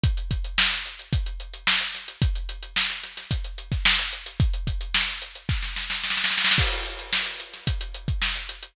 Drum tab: CC |--------------------------------|--------------------------------|--------------------------------|x-------------------------------|
HH |x-x-x-x---x-x-x-x-x-x-x---x-x-x-|x-x-x-x---x-x-x-x-x-x-x---x-x-x-|x-x-x-x---x-x-x-----------------|--x-x-x---x-x-x-x-x-x-x---x-x-x-|
SD |--------o---------------o---o---|--------o---o-o-------o-o-o-----|--------o-------o-o-o-o-oooooooo|--------o-----o---------o-------|
BD |o---o-----------o---------------|o---------------o-----o---------|o---o-----------o---------------|o---------------o-----o---------|